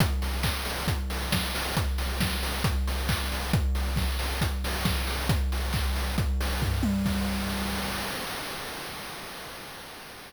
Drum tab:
CC |--------|--------|--------|--------|
HH |xo-oxo-o|xo-oxo-o|xo-oxo-o|xo-oxo--|
CP |--x-----|------x-|--------|--x-----|
SD |------o-|--o-----|--o---o-|--------|
T1 |--------|--------|--------|-------o|
FT |--------|--------|--------|------o-|
BD |o-o-o-o-|o-o-o-o-|o-o-o-o-|o-o-o-o-|

CC |x-------|
HH |--------|
CP |--------|
SD |--------|
T1 |--------|
FT |--------|
BD |o-------|